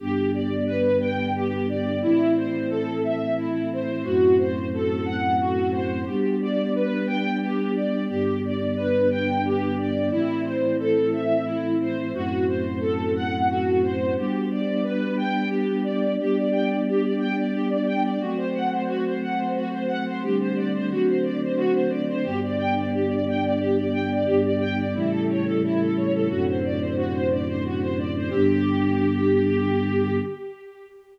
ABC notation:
X:1
M:3/4
L:1/16
Q:1/4=89
K:G
V:1 name="String Ensemble 1"
G2 d2 B2 g2 G2 d2 | E2 c2 A2 e2 E2 c2 | F2 c2 A2 f2 F2 c2 | G2 d2 B2 g2 G2 d2 |
G2 d2 B2 g2 G2 d2 | E2 c2 A2 e2 E2 c2 | F2 c2 A2 f2 F2 c2 | G2 d2 B2 g2 G2 d2 |
G d g d G d g d G d g d | F c f c F c f c F c f c | G c d c F c d c F c d c | G d g d G d g d G d g d |
G d g d E A ^c A E A c A | F c d c F c d c F c d c | G12 |]
V:2 name="Choir Aahs"
[G,,D,B,]12 | [A,,E,C]12 | [F,,A,,C]12 | [G,B,D]12 |
[G,,D,B,]12 | [A,,E,C]12 | [F,,A,,C]12 | [G,B,D]12 |
[G,B,D]12 | [F,A,C]12 | [D,G,A,C]4 [D,F,A,C]8 | [G,,D,B,]12 |
[G,,D,B,]4 [A,,^C,E,G,]8 | [F,,A,,C,D,]12 | [G,,D,B,]12 |]